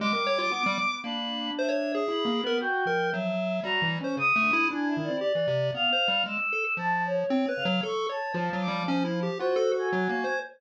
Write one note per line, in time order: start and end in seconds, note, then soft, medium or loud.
0.00 0.46 G3 medium
0.00 0.13 G#3 loud
0.00 0.94 D6 loud
0.13 0.25 A#4 medium
0.27 0.38 C#5 loud
0.38 0.50 F4 medium
0.51 0.63 B3 medium
0.51 0.98 B3 medium
0.66 0.78 G3 loud
1.04 1.51 A#3 medium
1.04 1.99 D4 medium
1.04 1.51 B5 medium
1.58 1.70 C5 medium
1.58 2.05 E5 medium
1.69 1.92 C#5 medium
1.95 2.42 G#4 medium
2.08 2.24 E4 medium
2.08 2.56 B5 medium
2.25 2.41 A#3 loud
2.44 2.59 B3 loud
2.44 2.58 A#4 medium
2.61 2.84 F#4 medium
2.61 3.08 G5 loud
2.86 3.33 F3 medium
2.86 3.10 A#4 medium
3.12 3.60 F#3 medium
3.12 3.59 E5 medium
3.63 3.80 F#3 medium
3.63 3.99 G3 medium
3.63 3.88 A#5 loud
3.82 3.98 E3 loud
4.01 4.16 C#4 medium
4.01 4.16 C5 medium
4.17 4.33 C#3 medium
4.17 4.65 D#6 loud
4.36 4.51 A3 loud
4.42 4.66 D3 medium
4.53 4.69 E4 loud
4.71 4.94 D4 medium
4.71 5.18 E4 medium
4.71 4.87 G#5 medium
4.87 5.03 E5 medium
4.97 5.09 D#3 medium
5.03 5.19 D5 medium
5.09 5.20 C4 medium
5.21 5.33 G4 medium
5.21 5.68 D5 loud
5.35 5.47 E3 medium
5.47 5.71 C3 medium
5.74 5.90 B3 medium
5.74 6.22 F5 loud
5.92 6.08 C5 medium
6.08 6.24 G3 medium
6.26 6.37 G#3 medium
6.26 6.74 E6 medium
6.52 6.64 A4 medium
6.77 7.24 F3 medium
6.77 7.02 A5 loud
7.06 7.53 C#5 loud
7.30 7.46 C4 loud
7.30 7.42 C4 medium
7.48 7.64 B4 medium
7.56 7.81 C#3 medium
7.56 7.79 F5 medium
7.65 7.81 F#3 loud
7.83 8.07 A4 medium
7.83 8.08 C#6 medium
8.09 8.33 C#5 medium
8.09 8.57 A5 medium
8.34 8.50 F3 medium
8.34 9.28 F3 loud
8.53 8.69 F#3 medium
8.61 8.84 D6 medium
8.68 8.83 G3 medium
8.87 9.04 C#4 loud
8.87 9.34 C5 medium
9.04 9.20 E4 medium
9.23 9.38 G4 medium
9.39 9.56 F4 medium
9.39 10.33 F#4 medium
9.39 9.74 C5 loud
9.56 9.72 A4 loud
9.73 9.89 A4 medium
9.79 10.37 G#5 medium
9.92 10.08 F#3 loud
10.09 10.25 A#3 medium
10.24 10.40 C5 medium